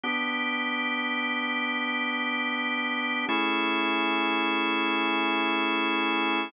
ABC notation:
X:1
M:4/4
L:1/8
Q:"Swing 16ths" 1/4=74
K:Edor
V:1 name="Drawbar Organ"
[B,DG]8 | [A,CE^G]8 |]